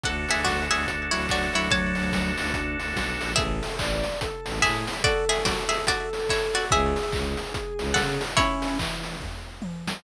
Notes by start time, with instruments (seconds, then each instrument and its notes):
0.03 violin D2, drawbar organ D4 F#4, harpsichord A4 F#5, kick, closed hi-hat
0.09 drawbar organ A4
0.29 violin D2, harpsichord G#4 E5, open hi-hat
0.45 violin D2, harpsichord F#4 D5, kick, snare
0.70 violin D2, harpsichord G#4 E5, snare, open hi-hat
0.87 violin D2, kick, closed hi-hat
1.11 violin D2, lead 1 (square) F#3, harpsichord E4 C#5, open hi-hat
1.29 violin D2, harpsichord F#4 D5, kick, clap
1.53 violin D2, lead 1 (square) F#3, harpsichord E4 C#5, open hi-hat
1.70 violin D2, lead 1 (square) F#3, harpsichord C#5 A5, kick, closed hi-hat
1.95 violin D2, open hi-hat
2.12 violin D2, kick, snare
2.38 violin D2, snare, open hi-hat
2.53 violin D2, lead 1 (square) D4, kick, closed hi-hat
2.79 violin D2, open hi-hat
2.96 violin B1, kick, snare
3.21 violin A#1, open hi-hat
3.36 violin A1, harpsichord G#4 E5, lead 1 (square) A4, kick, closed hi-hat
3.63 open hi-hat
3.79 violin A1, lead 1 (square) D5, kick, clap
4.04 open hi-hat
4.21 lead 1 (square) A4, kick, closed hi-hat
4.46 violin A1, snare, open hi-hat
4.62 violin A2, harpsichord G#4 E5, lead 1 (square) A4, kick, clap
4.87 open hi-hat
5.03 harpsichord F#4 D5, lead 1 (square) A4, kick, closed hi-hat
5.29 harpsichord G#4 E5, open hi-hat
5.45 harpsichord F#4 D5, kick, snare
5.69 harpsichord G#4 E5, open hi-hat
5.87 harpsichord F#4 D5, kick, closed hi-hat
6.13 open hi-hat
6.29 harpsichord E4 C#5, kick, clap
6.54 harpsichord F#4 D5, snare, open hi-hat
6.71 violin C#2, lead 1 (square) G#4, harpsichord G#4 E5, kick, closed hi-hat
6.96 open hi-hat
7.12 violin C#2, kick, clap
7.37 open hi-hat
7.54 kick, closed hi-hat
7.78 violin C#2, open hi-hat
7.94 violin C#3, harpsichord A4 F#5, kick, snare
8.21 open hi-hat
8.37 lead 1 (square) C#4, harpsichord E4 C#5, kick, closed hi-hat
8.62 open hi-hat
8.79 lead 1 (square) E3, kick, clap
9.04 open hi-hat
9.21 kick, floor tom
9.62 high tom
9.88 snare